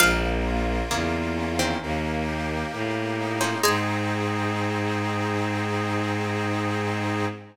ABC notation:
X:1
M:4/4
L:1/16
Q:1/4=66
K:Ab
V:1 name="Harpsichord"
f12 z4 | a16 |]
V:2 name="Harpsichord"
[A,,F,]4 [D,B,]2 z [E,C]5 z3 [F,D] | A,16 |]
V:3 name="Accordion"
B,2 F2 B,2 D2 B,2 G2 B,2 E2 | [CEA]16 |]
V:4 name="Violin" clef=bass
B,,,4 =E,,4 _E,,4 =A,,4 | A,,16 |]